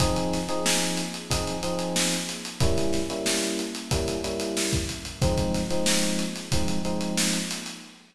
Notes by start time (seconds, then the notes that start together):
0.00 F3 C4 D#4 G#4, kick, closed hi-hat
0.16 closed hi-hat
0.33 snare, closed hi-hat
0.49 F3 C4 D#4 G#4, closed hi-hat
0.66 snare
0.82 closed hi-hat
0.97 closed hi-hat
1.14 closed hi-hat
1.30 F3 C4 D#4 G#4, kick, closed hi-hat
1.47 closed hi-hat
1.63 F3 C4 D#4 G#4, closed hi-hat
1.79 closed hi-hat
1.96 snare
2.12 snare, closed hi-hat
2.29 snare, closed hi-hat
2.45 closed hi-hat
2.60 G3 A#3 C#4 E4, kick, closed hi-hat
2.77 snare, closed hi-hat
2.93 snare, closed hi-hat
3.10 G3 A#3 C#4 E4, closed hi-hat
3.26 snare
3.43 closed hi-hat
3.59 closed hi-hat
3.75 closed hi-hat
3.91 G3 A#3 C#4 E4, kick, closed hi-hat
4.08 closed hi-hat
4.24 G3 A#3 C#4 E4, closed hi-hat
4.40 closed hi-hat
4.57 snare
4.73 kick, closed hi-hat
4.89 closed hi-hat
5.05 closed hi-hat
5.22 F3 G#3 C4 D#4, kick, closed hi-hat
5.37 kick, closed hi-hat
5.54 snare, closed hi-hat
5.71 F3 G#3 C4 D#4, closed hi-hat
5.86 snare
6.03 closed hi-hat
6.19 closed hi-hat
6.36 snare, closed hi-hat
6.52 F3 G#3 C4 D#4, kick, closed hi-hat
6.68 closed hi-hat
6.85 F3 G#3 C4 D#4, closed hi-hat
7.01 closed hi-hat
7.17 snare
7.33 closed hi-hat
7.51 closed hi-hat
7.66 closed hi-hat